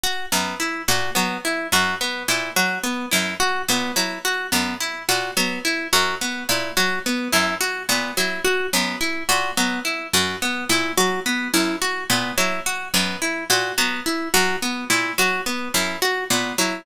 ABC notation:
X:1
M:6/4
L:1/8
Q:1/4=107
K:none
V:1 name="Pizzicato Strings" clef=bass
z _G,, z _B,, _G, z G,, z B,, G, z G,, | z _B,, _G, z _G,, z B,, G, z G,, z B,, | _G, z _G,, z _B,, G, z G,, z B,, G, z | _G,, z _B,, _G, z G,, z B,, G, z G,, z |
_B,, _G, z _G,, z B,, G, z G,, z B,, G, |]
V:2 name="Orchestral Harp"
_G B, E G B, E G B, E G B, E | _G B, E G B, E G B, E G B, E | _G B, E G B, E G B, E G B, E | _G B, E G B, E G B, E G B, E |
_G B, E G B, E G B, E G B, E |]